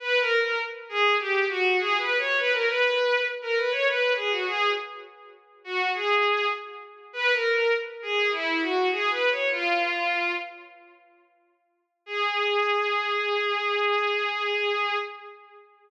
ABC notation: X:1
M:4/4
L:1/16
Q:1/4=101
K:G#m
V:1 name="Violin"
(3B2 A2 A2 z2 G2 =G2 F2 (3^G2 B2 c2 | B A B4 z A B c B2 G F G2 | z6 F2 G4 z4 | (3B2 A2 A2 z2 G2 E2 F2 (3G2 B2 c2 |
"^rit." ^E6 z10 | G16 |]